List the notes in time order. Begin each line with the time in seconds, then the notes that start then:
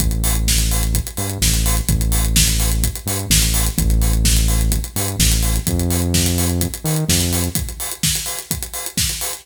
0.00 A1, kick, closed hi-hat
0.11 closed hi-hat
0.24 open hi-hat
0.35 closed hi-hat
0.48 kick, snare
0.58 closed hi-hat
0.71 open hi-hat
0.83 closed hi-hat
0.94 kick, closed hi-hat
1.07 closed hi-hat
1.17 G2, open hi-hat
1.30 closed hi-hat
1.41 A1, kick, snare
1.54 closed hi-hat
1.66 open hi-hat
1.77 closed hi-hat
1.88 A1, kick, closed hi-hat
2.01 closed hi-hat
2.12 open hi-hat
2.25 closed hi-hat
2.36 kick, snare
2.48 closed hi-hat
2.60 open hi-hat
2.72 closed hi-hat
2.83 kick, closed hi-hat
2.95 closed hi-hat
3.06 G2, open hi-hat
3.19 closed hi-hat
3.30 A1, kick, snare
3.42 closed hi-hat
3.54 open hi-hat
3.66 closed hi-hat
3.78 A1, kick, closed hi-hat
3.90 closed hi-hat
4.02 open hi-hat
4.13 closed hi-hat
4.25 kick, snare
4.37 closed hi-hat
4.48 open hi-hat
4.61 closed hi-hat
4.72 kick, closed hi-hat
4.84 closed hi-hat
4.96 G2, open hi-hat
5.08 closed hi-hat
5.19 A1, kick, snare
5.32 closed hi-hat
5.43 open hi-hat
5.56 closed hi-hat
5.67 F2, kick, closed hi-hat
5.79 closed hi-hat
5.90 open hi-hat
6.02 closed hi-hat
6.14 kick, snare
6.26 closed hi-hat
6.38 open hi-hat
6.50 closed hi-hat
6.61 kick, closed hi-hat
6.74 closed hi-hat
6.84 D#3, open hi-hat
6.96 closed hi-hat
7.09 F2, kick, snare
7.20 closed hi-hat
7.33 open hi-hat
7.44 closed hi-hat
7.55 kick, closed hi-hat
7.69 closed hi-hat
7.80 open hi-hat
7.92 closed hi-hat
8.03 kick, snare
8.15 closed hi-hat
8.26 open hi-hat
8.39 closed hi-hat
8.51 kick, closed hi-hat
8.63 closed hi-hat
8.74 open hi-hat
8.86 closed hi-hat
8.97 kick, snare
9.09 closed hi-hat
9.21 open hi-hat
9.33 closed hi-hat